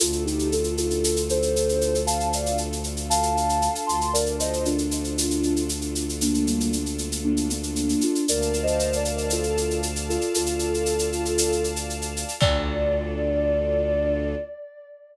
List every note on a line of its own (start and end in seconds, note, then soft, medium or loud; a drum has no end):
0.00 3.69 D2 loud
0.00 4.09 D4 medium
0.00 0.23 F4 medium
0.00 4.09 F4 medium
0.00 0.23 A4 medium
0.00 4.09 A4 medium
0.00 shaker loud
0.12 shaker medium
0.25 0.48 D#4 medium
0.25 0.48 G4 medium
0.25 shaker medium
0.39 shaker medium
0.52 0.75 F4 medium
0.52 0.75 A4 medium
0.52 shaker medium
0.64 shaker medium
0.77 1.21 F4 medium
0.77 1.21 A4 medium
0.77 shaker medium
0.90 shaker medium
1.04 shaker loud
1.16 shaker medium
1.29 2.00 A4 medium
1.29 2.00 C5 medium
1.29 shaker medium
1.42 shaker medium
1.56 shaker medium
1.69 shaker medium
1.81 shaker medium
1.95 shaker medium
2.07 2.28 F5 medium
2.07 2.28 A5 medium
2.07 shaker loud
2.20 shaker medium
2.33 2.56 D5 medium
2.33 2.56 F5 medium
2.33 shaker loud
2.46 shaker medium
2.58 shaker medium
2.73 shaker medium
2.84 shaker medium
2.97 shaker medium
3.10 3.34 F5 medium
3.10 3.34 A5 medium
3.10 shaker loud
3.23 shaker medium
3.35 3.85 F5 medium
3.35 3.85 A5 medium
3.35 shaker medium
3.49 shaker medium
3.62 shaker medium
3.75 shaker medium
3.86 7.95 D2 medium
3.86 4.10 A5 medium
3.86 4.10 C6 medium
3.86 shaker medium
4.01 shaker medium
4.13 8.24 D4 medium
4.13 8.24 F4 medium
4.13 8.24 A4 medium
4.13 4.35 A#4 medium
4.13 4.35 D5 medium
4.13 shaker loud
4.26 shaker medium
4.40 4.62 C5 medium
4.40 4.62 D#5 medium
4.40 shaker loud
4.53 shaker medium
4.65 5.61 D4 medium
4.65 5.61 F4 medium
4.65 shaker medium
4.78 shaker medium
4.91 shaker medium
5.04 shaker medium
5.18 shaker loud
5.31 shaker medium
5.43 shaker medium
5.56 shaker medium
5.69 shaker loud
5.81 shaker medium
5.95 shaker medium
6.09 shaker medium
6.21 6.43 A#3 medium
6.21 6.43 D4 medium
6.21 shaker loud
6.34 shaker medium
6.47 6.70 G3 medium
6.47 6.70 A#3 medium
6.47 shaker medium
6.60 shaker medium
6.73 shaker medium
6.86 shaker medium
6.98 shaker medium
7.12 shaker medium
7.24 7.48 A#3 medium
7.24 7.48 D4 medium
7.37 shaker medium
7.50 8.01 A#3 medium
7.50 8.01 D4 medium
7.50 shaker medium
7.63 shaker medium
7.76 shaker medium
7.89 shaker medium
8.01 8.25 D4 medium
8.01 8.25 F4 medium
8.01 shaker medium
8.15 shaker medium
8.26 10.18 D2 loud
8.26 8.57 A#4 medium
8.26 12.36 D5 medium
8.26 8.57 D5 medium
8.26 12.36 F5 medium
8.26 12.36 A5 medium
8.26 shaker loud
8.42 shaker medium
8.53 shaker medium
8.63 8.94 C5 medium
8.63 8.94 D#5 medium
8.67 shaker medium
8.79 shaker medium
8.93 9.25 A#4 medium
8.93 9.25 D5 medium
8.93 shaker medium
9.05 shaker medium
9.18 shaker medium
9.30 9.56 F4 medium
9.30 9.56 A4 medium
9.30 shaker loud
9.43 shaker medium
9.57 9.77 F4 medium
9.57 9.77 A4 medium
9.57 shaker medium
9.70 shaker medium
9.83 shaker medium
9.96 shaker medium
10.09 10.33 F4 medium
10.09 10.33 A4 medium
10.09 shaker medium
10.21 shaker medium
10.34 12.25 D2 medium
10.34 11.65 F4 medium
10.34 11.65 A4 medium
10.34 shaker loud
10.46 shaker medium
10.59 shaker medium
10.74 shaker medium
10.86 shaker medium
10.99 shaker medium
11.12 shaker medium
11.25 shaker medium
11.38 shaker loud
11.52 shaker medium
11.64 shaker medium
11.76 shaker medium
11.90 shaker medium
12.02 shaker medium
12.17 shaker medium
12.28 shaker medium
12.41 14.35 D2 loud
12.41 14.35 D4 loud
12.41 14.35 F4 loud
12.41 14.35 A4 loud
12.41 14.34 D5 loud
12.41 kick loud
12.41 crash loud